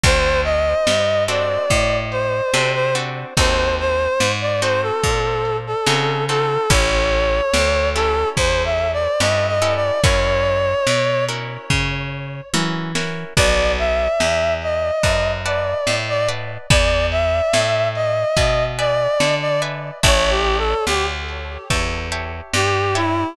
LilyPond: <<
  \new Staff \with { instrumentName = "Clarinet" } { \time 4/4 \key a \major \tempo 4 = 72 c''8 ees''4 d''4 c''8. c''16 r8 | c''8 c''8. d''16 c''16 a'4 a'8. a'8 | cis''4. a'8 \tuplet 3/2 { c''8 e''8 d''8 dis''8 ees''8 d''8 } | cis''4. r2 r8 |
d''8 e''4 ees''4 d''8. d''16 r8 | d''8 e''4 ees''4 d''8. d''16 r8 | \tuplet 3/2 { cis''8 g'8 a'8 } g'16 r4. r16 g'8 e'8 | }
  \new Staff \with { instrumentName = "Acoustic Guitar (steel)" } { \time 4/4 \key a \major <c' d' fis' a'>4. <c' d' fis' a'>4. <c' d' fis' a'>8 <c' d' fis' a'>8 | <c' dis' fis' a'>4. <c' dis' fis' a'>4. <c' dis' fis' a'>8 <c' dis' fis' a'>8 | <cis' e' g' a'>4. <cis' e' g' a'>4. <cis' e' g' a'>8 <cis' e' g' a'>8 | <cis' e' fis' ais'>4. <cis' e' fis' ais'>4. <cis' e' fis' ais'>8 <cis' e' fis' ais'>8 |
<b' d'' fis'' a''>2 <b' d'' fis'' a''>8 <b' d'' fis'' a''>4 <b' d'' fis'' a''>8 | <b' d'' e'' gis''>2 <b' d'' e'' gis''>8 <b' d'' e'' gis''>4 <b' d'' e'' gis''>8 | <cis'' e'' g'' a''>2 <cis'' e'' g'' a''>8 <cis'' e'' g'' a''>4 <cis'' e'' g'' a''>8 | }
  \new Staff \with { instrumentName = "Electric Bass (finger)" } { \clef bass \time 4/4 \key a \major d,4 g,4 a,4 c4 | dis,4 gis,4 ais,4 cis4 | a,,4 d,4 e,4 g,4 | fis,4 b,4 cis4 e4 |
b,,4 e,4 fis,4 a,4 | e,4 a,4 b,4 d4 | a,,4 d,4 e,4 g,4 | }
  \new DrumStaff \with { instrumentName = "Drums" } \drummode { \time 4/4 <hh bd>8 hh8 sn8 hh8 <hh bd>8 hh8 sn8 hh8 | <hh bd>8 hh8 sn8 hh8 <hh bd>8 hh8 sn8 hh8 | <hh bd>8 hh8 sn8 hh8 <hh bd>8 hh8 sn8 hh8 | <hh bd>8 hh8 sn8 hh8 <bd tomfh>4 tommh8 sn8 |
<cymc bd>8 hh8 sn8 hh8 <hh bd>8 hh8 sn8 hh8 | <hh bd>8 hh8 sn8 hh8 <hh bd>8 hh8 sn8 hh8 | <hh bd>8 hh8 sn8 hh8 <hh bd>8 hh8 sn8 hh8 | }
>>